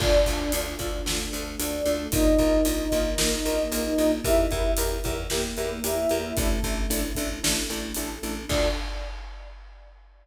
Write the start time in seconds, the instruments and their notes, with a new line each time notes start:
0.00 electric bass (finger) D2, acoustic grand piano D4 F4 A4, flute D4 D5, choir aahs D4 F4 A4, kick, crash
0.26 electric bass (finger) D2, acoustic grand piano D4 F4 A4, kick, closed hi-hat
0.52 electric bass (finger) D2, acoustic grand piano D4 F4 A4, closed hi-hat
0.79 electric bass (finger) D2, acoustic grand piano D4 F4 A4, kick, closed hi-hat
1.06 electric bass (finger) D2, choir aahs A3 D4 A4, acoustic grand piano D4 F4 A4, snare
1.33 electric bass (finger) D2, acoustic grand piano D4 F4 A4, closed hi-hat
1.59 electric bass (finger) D2, acoustic grand piano D4 F4 A4, flute D4 D5, closed hi-hat
1.86 electric bass (finger) D2, acoustic grand piano D4 F4 A4, closed hi-hat
2.12 electric bass (finger) A#1, flute D#4 D#5, acoustic grand piano D#4 F4 A#4, choir aahs D#4 F4 A#4, kick, closed hi-hat
2.38 electric bass (finger) A#1, acoustic grand piano D#4 F4 A#4, kick, closed hi-hat
2.65 electric bass (finger) A#1, acoustic grand piano D#4 F4 A#4, closed hi-hat
2.92 electric bass (finger) A#1, acoustic grand piano D#4 F4 A#4, kick, closed hi-hat
3.18 electric bass (finger) A#1, choir aahs A#3 D#4 A#4, acoustic grand piano D#4 F4 A#4, snare
3.45 electric bass (finger) A#1, acoustic grand piano D#4 F4 A#4, closed hi-hat
3.72 electric bass (finger) A#1, acoustic grand piano D#4 F4 A#4, closed hi-hat
3.98 electric bass (finger) A#1, acoustic grand piano D#4 F4 A#4, closed hi-hat
4.24 electric bass (finger) E2, acoustic grand piano E4 G4 A#4, choir aahs E4 G4 A#4, flute E4 E5, kick, closed hi-hat
4.51 electric bass (finger) E2, acoustic grand piano E4 G4 A#4, kick, closed hi-hat
4.77 electric bass (finger) E2, acoustic grand piano E4 G4 A#4, closed hi-hat
5.04 electric bass (finger) E2, acoustic grand piano E4 G4 A#4, kick, closed hi-hat
5.30 electric bass (finger) E2, choir aahs A#3 E4 A#4, acoustic grand piano E4 G4 A#4, snare
5.57 electric bass (finger) E2, acoustic grand piano E4 G4 A#4, closed hi-hat
5.84 electric bass (finger) E2, acoustic grand piano E4 G4 A#4, flute E4 E5, closed hi-hat
6.09 electric bass (finger) E2, acoustic grand piano E4 G4 A#4, closed hi-hat
6.37 electric bass (finger) A1, flute A3 A4, acoustic grand piano D4 E4 A4, choir aahs D4 E4 A4, kick, closed hi-hat
6.63 electric bass (finger) A1, acoustic grand piano D4 E4 A4, kick, closed hi-hat
6.90 electric bass (finger) A1, acoustic grand piano D4 E4 A4, closed hi-hat
7.15 electric bass (finger) A1, acoustic grand piano D4 E4 A4, kick, closed hi-hat
7.43 electric bass (finger) A1, choir aahs A3 D4 A4, acoustic grand piano D4 E4 A4, snare
7.70 electric bass (finger) A1, acoustic grand piano D4 E4 A4, closed hi-hat
7.94 electric bass (finger) A1, acoustic grand piano D4 E4 A4, closed hi-hat
8.23 electric bass (finger) A1, acoustic grand piano D4 E4 A4, closed hi-hat
8.49 electric bass (finger) D2, choir aahs D4 F4 A4, acoustic grand piano D4 F4 A4, flute D5, kick, crash